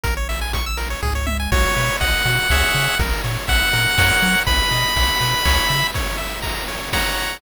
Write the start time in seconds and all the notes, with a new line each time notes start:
0.03 A#1 A#4, kick, closed hi-hat
0.17 C#5
0.29 E5, open hi-hat
0.41 G#5
0.53 C#6, kick, closed hi-hat
0.66 E6
0.77 A#4, open hi-hat
0.90 C#5
1.03 C#2 G#4, kick, floor tom
1.15 C#5
1.26 E5, high tom
1.40 G#5
1.52 B1 F#4 C#5, kick, crash
1.77 B2 B4, ride
2.00 B1 D#5 F#5, kick, ride
2.25 B2 F#4, ride
2.50 C#2 G#4 C#5 E5, kick, snare
2.74 C#3, ride
2.99 A#1 A#4, kick, ride
3.24 A#2 C#5, ride
3.47 A#1 E5 F#5, kick, ride
3.73 A#2 A#4, ride
3.98 F#2 A#4 C#5 F#5, kick, snare
4.22 F#3, ride
4.47 B1 B4 B5, kick, ride
4.71 B2 D#5, ride
4.96 B1 F#5, kick, ride
5.21 B2 B4, ride
5.45 C#2 C#5, kick, snare
5.69 C#3 E5, ride
5.94 C#5, kick, ride
6.18 E5, ride
6.42 A#5, kick, ride
6.68 C#5, ride
6.93 C#5 F#5 A#5, kick, snare
7.17 ride